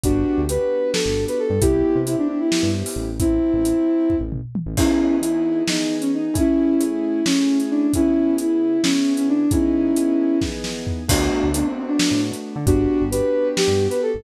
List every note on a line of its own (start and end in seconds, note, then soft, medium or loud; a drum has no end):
0.03 0.24 G1 medium
0.03 0.44 B3 medium
0.03 0.41 D4 medium
0.03 0.44 D4 medium
0.03 0.41 F#4 medium
0.03 0.44 F#4 medium
0.03 0.44 G4 medium
0.03 kick loud
0.03 closed hi-hat loud
0.38 0.58 D2 medium
0.49 1.51 B3 medium
0.49 1.51 D4 medium
0.49 1.51 F#4 medium
0.49 1.51 G4 medium
0.49 0.90 B4 medium
0.49 closed hi-hat loud
0.93 1.24 A4 medium
0.93 snare loud
1.06 1.26 G1 medium
1.28 1.39 B4 medium
1.28 closed hi-hat medium
1.39 1.61 A4 medium
1.50 1.60 G2 medium
1.61 1.83 C2 medium
1.61 2.02 B3 medium
1.61 2.02 C4 medium
1.61 2.02 E4 medium
1.61 1.98 E4 medium
1.61 2.02 G4 medium
1.61 1.98 G4 medium
1.61 kick loud
1.61 closed hi-hat loud
1.95 2.16 C3 medium
2.06 3.09 B3 medium
2.06 3.09 C4 medium
2.06 2.16 E4 medium
2.06 3.09 E4 medium
2.06 3.09 G4 medium
2.06 closed hi-hat loud
2.18 2.27 D4 medium
2.28 2.38 D4 medium
2.40 2.69 E4 medium
2.52 snare loud
2.63 2.83 G2 medium
2.86 open hi-hat medium
2.96 3.39 A1 medium
3.19 4.15 C4 medium
3.19 4.15 E4 medium
3.19 kick loud
3.19 closed hi-hat loud
3.54 3.74 A1 medium
3.65 closed hi-hat loud
4.10 kick medium
4.10 floor tom medium
4.21 4.41 A1 medium
4.32 mid tom loud
4.55 high tom loud
4.66 4.76 A1 medium
4.77 5.19 E3 loud
4.77 5.19 B3 loud
4.77 5.16 C#4 medium
4.77 5.19 D#4 loud
4.77 5.16 E4 medium
4.77 5.19 G#4 medium
4.77 kick loud
4.77 crash loud
5.21 5.62 E3 medium
5.21 5.62 B3 medium
5.21 5.62 D#4 medium
5.21 5.62 E4 medium
5.21 5.62 G#4 medium
5.21 closed hi-hat loud
5.67 6.29 E3 medium
5.67 6.29 B3 medium
5.67 5.95 D#4 medium
5.67 6.29 D#4 medium
5.67 6.29 G#4 medium
5.67 snare loud
6.01 6.11 C#4 medium
6.01 closed hi-hat medium
6.13 6.35 D#4 medium
6.34 6.74 A3 medium
6.34 6.74 C#4 loud
6.34 6.81 C#4 medium
6.34 6.74 E4 loud
6.34 6.81 E4 medium
6.34 6.74 G#4 loud
6.34 kick loud
6.34 closed hi-hat loud
6.80 7.21 A3 medium
6.80 7.21 C#4 medium
6.80 7.21 E4 medium
6.80 7.24 E4 medium
6.80 7.21 G#4 medium
6.80 closed hi-hat loud
7.26 7.87 A3 medium
7.26 7.58 C#4 medium
7.26 7.87 C#4 medium
7.26 7.87 E4 medium
7.26 7.87 G#4 medium
7.26 snare loud
7.60 closed hi-hat medium
7.71 7.91 D4 medium
7.93 8.36 C#3 medium
7.93 8.36 B3 loud
7.93 8.34 C#4 medium
7.93 8.34 E4 medium
7.93 8.36 E4 medium
7.93 8.36 G#4 medium
7.93 kick medium
7.93 closed hi-hat loud
8.37 8.77 C#3 medium
8.37 8.77 B3 medium
8.37 8.77 E4 medium
8.37 8.81 E4 medium
8.37 8.77 G#4 medium
8.37 closed hi-hat loud
8.82 9.44 C#3 medium
8.82 9.44 B3 medium
8.82 9.13 C#4 medium
8.82 9.44 E4 medium
8.82 9.44 G#4 medium
8.82 snare loud
9.17 9.28 C#4 medium
9.17 closed hi-hat medium
9.29 9.50 D4 medium
9.51 9.92 E3 loud
9.51 9.92 B3 medium
9.51 10.39 C#4 medium
9.51 9.92 D#4 loud
9.51 10.39 E4 medium
9.51 9.92 G#4 medium
9.51 kick loud
9.51 closed hi-hat loud
9.96 10.38 E3 medium
9.96 10.38 B3 medium
9.96 10.38 D#4 medium
9.96 10.38 G#4 medium
9.96 closed hi-hat loud
10.41 11.03 E3 medium
10.41 11.03 B3 medium
10.41 11.03 D#4 medium
10.41 11.03 G#4 medium
10.41 kick medium
10.41 snare medium
10.64 snare medium
10.87 floor tom loud
11.08 11.29 D2 medium
11.08 11.49 A3 medium
11.08 11.49 B3 medium
11.08 11.48 D4 medium
11.08 11.49 D4 loud
11.08 11.48 F#4 medium
11.08 11.49 F#4 loud
11.08 kick loud
11.08 crash loud
11.43 11.63 D2 medium
11.54 12.56 A3 medium
11.54 12.56 B3 medium
11.54 12.56 D4 medium
11.54 11.66 D4 medium
11.54 12.56 F#4 medium
11.54 closed hi-hat loud
11.66 11.77 C4 medium
11.78 11.88 C4 medium
11.88 12.20 D4 medium
11.99 snare loud
12.11 12.31 A2 medium
12.33 closed hi-hat medium
12.56 12.66 D3 medium
12.67 12.87 G1 loud
12.67 13.08 B3 medium
12.67 13.03 D4 medium
12.67 13.08 D4 loud
12.67 13.03 F#4 medium
12.67 13.08 F#4 loud
12.67 13.08 G4 loud
12.67 kick loud
12.67 closed hi-hat loud
13.01 13.22 G1 medium
13.11 14.14 B3 medium
13.11 14.14 D4 medium
13.11 14.14 F#4 medium
13.11 14.14 G4 medium
13.11 13.47 B4 medium
13.11 closed hi-hat loud
13.57 13.85 G4 medium
13.57 snare loud
13.68 13.88 G2 medium
13.90 14.01 B4 medium
13.90 closed hi-hat medium
14.02 14.23 A4 medium
14.14 14.23 G1 medium